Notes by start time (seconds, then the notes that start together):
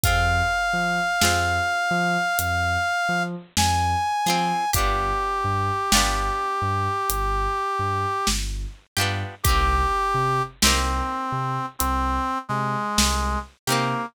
0.03 F2 C4 F4 G#4 F5, kick, closed hi-hat
0.73 F3
1.21 F2 C4 F4 G#4, snare
1.91 F3
2.39 F2, closed hi-hat
3.09 F3
3.57 F2 G#5, snare
4.26 F3 C4 F4 G#4, snare
4.73 G1 D4 F4 G4, kick, closed hi-hat
4.78 B3
5.44 G2
5.92 G1 D4 F4 G4, snare
5.97 B3
6.62 G2
7.09 G1, closed hi-hat
7.79 G2
8.27 G1, snare
8.97 G2 D4 F4 G4, snare
9.01 B3
9.43 C2 D#4 G4, kick, closed hi-hat
9.48 A#3 C4
10.14 C3
10.62 C2 C4 D#4 G4, snare
10.67 A#3
11.32 C3
11.79 C2 C4, closed hi-hat
12.49 C3 G#3
12.98 C2, snare
13.67 C3 A#3 C4 D#4 G4, snare
13.72 A#3